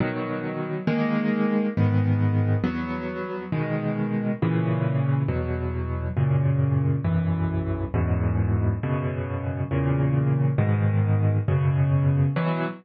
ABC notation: X:1
M:6/8
L:1/8
Q:3/8=68
K:B
V:1 name="Acoustic Grand Piano"
[B,,D,F,]3 [D,G,A,]3 | [G,,D,B,]3 [E,,F,B,]3 | [B,,D,G,]3 [A,,C,E,]3 | [E,,B,,F,]3 [F,,A,,C,]3 |
[B,,,F,,E,]3 [E,,F,,G,,B,,]3 | [F,,B,,C,]3 [E,,A,,C,]3 | [G,,B,,D,]3 [F,,B,,C,]3 | [B,,E,F,]3 z3 |]